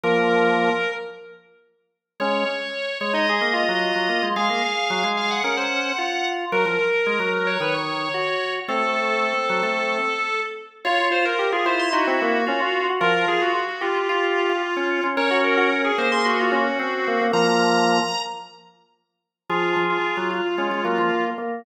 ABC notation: X:1
M:4/4
L:1/16
Q:1/4=111
K:Bbm
V:1 name="Drawbar Organ"
B8 z8 | d6 d e9 | f6 f g9 | B6 B d9 |
=A14 z2 | d2 c B2 A c c' G8 | B2 A G2 G F F F8 | d2 B B2 A c c' G8 |
b8 z8 | F3 F3 F3 F F F2 z3 |]
V:2 name="Drawbar Organ"
B,6 z10 | D2 z5 E A2 F6 | A8 B c3 F4 | B8 _c d3 G4 |
C10 z6 | F z F2 =G F F2 E C B,2 D F2 _G | F4 z2 =G6 z4 | B G2 G z A2 A2 F D2 z2 B, B, |
B,6 z10 | A6 F2 D2 B,4 B,2 |]
V:3 name="Drawbar Organ"
F,6 z10 | A,2 z4 A,3 B,2 G,2 G, B, A, | A, B, z2 G, A,3 D4 z4 | G, F, z2 A, G,3 E,4 z4 |
=A,6 G, A,3 z6 | F3 z3 =E6 F4 | F,2 z6 F3 F z D2 D | D6 B,6 C4 |
F,6 z10 | F,2 F,2 z G,2 z A, A, G, F, z4 |]